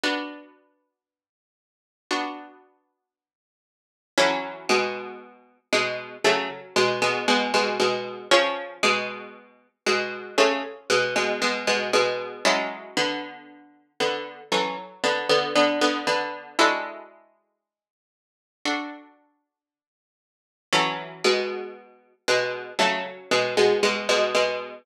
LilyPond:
<<
  \new Staff \with { instrumentName = "Harpsichord" } { \time 4/4 \key fis \minor \tempo 4 = 58 r1 | <e cis'>8 <b, gis>4 <b, gis>8 <cis a>16 r16 <b, gis>16 <b, gis>16 <b, gis>16 <b, gis>16 <b, gis>8 | <eis cis'>8 <b, gis>4 <b, gis>8 <cis a>16 r16 <b, gis>16 <b, gis>16 <b, gis>16 <b, gis>16 <b, gis>8 | <gis e'>8 <d b>4 <d b>8 <e cis'>16 r16 <d b>16 <d b>16 <d b>16 <d b>16 <d b>8 |
<gis e'>2~ <gis e'>8 r4. | <e cis'>8 <b, gis>4 <b, gis>8 <cis a>16 r16 <b, gis>16 <b, gis>16 <b, gis>16 <b, gis>16 <b, gis>8 | }
  \new Staff \with { instrumentName = "Harpsichord" } { \time 4/4 \key fis \minor <b d' fis'>2 <b d' fis'>2 | <fis a'>2 <fis cis' a'>2 | <cis' eis' gis'>2 <cis' eis' gis'>2 | <fis cis' a'>2 <fis a'>2 |
<d' fis' a'>2 <d' fis' a'>2 | <fis a'>2 <fis cis' a'>2 | }
>>